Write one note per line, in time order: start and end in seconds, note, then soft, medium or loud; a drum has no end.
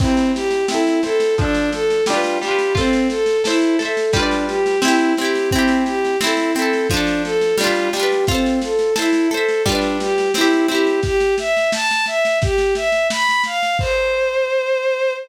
0.00 0.31 C4 medium
0.00 0.64 C4 medium
0.00 0.64 E4 medium
0.00 kick loud
0.00 snare medium
0.00 crash loud
0.07 0.64 G4 medium
0.17 snare medium
0.34 0.66 G4 medium
0.34 snare medium
0.51 snare medium
0.68 1.00 C4 medium
0.68 1.01 E4 medium
0.68 1.00 E4 medium
0.68 snare loud
0.74 1.00 A4 medium
0.87 snare medium
1.03 1.35 C4 medium
1.03 1.35 E4 medium
1.03 1.35 A4 medium
1.03 snare medium
1.10 1.35 A4 medium
1.20 snare medium
1.38 2.02 F3 medium
1.38 1.70 D4 loud
1.38 2.02 D4 medium
1.38 kick loud
1.38 snare medium
1.44 2.02 A4 medium
1.55 snare medium
1.72 2.04 A4 medium
1.72 snare medium
1.90 snare medium
2.06 2.39 G3 medium
2.06 2.39 D4 medium
2.06 2.38 F4 medium
2.06 snare loud
2.13 2.39 F4 medium
2.13 2.39 B4 medium
2.24 snare medium
2.42 2.73 G3 medium
2.42 2.73 D4 medium
2.42 2.74 G4 medium
2.42 snare medium
2.48 2.73 F4 medium
2.48 2.73 B4 medium
2.59 snare medium
2.75 3.08 C4 loud
2.75 3.38 F4 medium
2.75 3.38 A4 medium
2.75 kick loud
2.75 snare loud
2.81 3.38 C5 medium
2.93 snare medium
3.10 3.42 A4 medium
3.10 snare medium
3.26 snare medium
3.44 3.77 E4 medium
3.44 3.76 A4 medium
3.44 3.76 C5 medium
3.44 snare loud
3.50 3.76 E5 medium
3.61 snare medium
3.79 4.11 A4 medium
3.79 4.11 C5 medium
3.79 snare medium
3.85 4.11 E5 medium
3.97 snare medium
4.13 4.77 G3 medium
4.13 4.45 D4 medium
4.13 4.77 F4 medium
4.13 kick loud
4.13 snare medium
4.20 4.77 B4 medium
4.20 4.77 D5 medium
4.31 snare medium
4.48 4.80 G4 medium
4.48 snare medium
4.66 snare medium
4.82 5.14 C4 medium
4.82 5.15 E4 medium
4.82 5.14 E4 medium
4.82 snare loud
4.88 5.14 G4 medium
4.99 snare medium
5.17 5.50 C4 medium
5.17 5.49 G4 medium
5.17 snare medium
5.21 5.50 E4 medium
5.21 5.50 G4 medium
5.35 snare medium
5.51 5.83 C4 medium
5.51 6.16 C4 medium
5.51 kick loud
5.51 snare medium
5.55 6.16 E4 medium
5.55 6.16 G4 medium
5.68 snare medium
5.86 6.18 G4 medium
5.86 snare medium
6.04 snare medium
6.20 6.52 C4 medium
6.20 6.52 E4 medium
6.20 snare loud
6.27 6.52 A4 medium
6.37 snare medium
6.55 6.87 C4 medium
6.55 6.87 A4 medium
6.55 snare medium
6.59 6.87 E4 medium
6.59 6.87 A4 medium
6.73 snare medium
6.90 7.54 F3 medium
6.90 7.22 D4 medium
6.90 kick loud
6.90 snare medium
6.94 7.54 D4 medium
6.94 7.54 A4 medium
7.07 snare medium
7.24 7.56 A4 medium
7.24 snare medium
7.41 snare medium
7.57 7.89 G3 medium
7.57 7.89 D4 medium
7.57 7.90 F4 medium
7.57 snare loud
7.64 7.89 F4 medium
7.64 7.89 B4 medium
7.76 snare medium
7.93 8.25 G3 medium
7.93 8.25 D4 medium
7.93 8.25 G4 medium
7.93 snare loud
8.00 8.25 F4 medium
8.00 8.25 B4 medium
8.12 snare medium
8.27 8.59 C4 medium
8.27 8.92 F4 medium
8.27 kick loud
8.27 snare medium
8.31 8.92 A4 medium
8.31 8.92 C5 medium
8.46 snare medium
8.61 8.94 A4 medium
8.61 snare medium
8.79 snare medium
8.96 9.28 E4 medium
8.96 9.28 A4 medium
8.96 9.28 C5 medium
8.96 snare loud
9.02 9.28 E5 medium
9.13 snare medium
9.30 9.62 A4 medium
9.30 9.63 A4 medium
9.30 9.63 C5 medium
9.30 snare medium
9.37 9.63 E5 medium
9.48 snare medium
9.66 10.29 G3 medium
9.66 9.97 D4 medium
9.66 10.29 F4 medium
9.66 kick loud
9.66 snare medium
9.72 10.29 B4 medium
9.72 10.29 D5 medium
9.81 snare medium
10.00 10.32 G4 medium
10.00 snare medium
10.18 snare medium
10.34 10.67 C4 medium
10.34 10.67 E4 medium
10.34 snare loud
10.41 10.67 G4 medium
10.53 snare medium
10.68 11.00 C4 medium
10.68 11.00 E4 medium
10.68 11.00 G4 medium
10.68 snare medium
10.75 11.00 G4 medium
10.87 snare medium
11.03 11.35 G4 loud
11.03 kick loud
11.03 snare medium
11.20 snare medium
11.38 11.70 E5 medium
11.38 snare loud
11.57 snare medium
11.72 12.05 A5 loud
11.72 snare loud
11.91 snare medium
12.06 12.38 E5 medium
12.06 snare medium
12.25 snare medium
12.42 12.74 G4 medium
12.42 kick loud
12.42 snare loud
12.58 snare medium
12.75 13.07 E5 medium
12.75 snare medium
12.92 snare medium
13.10 13.42 B5 medium
13.10 snare loud
13.29 snare medium
13.44 13.77 F5 medium
13.44 snare medium
13.63 snare medium
13.79 15.13 C5 loud
13.79 kick loud
13.79 crash loud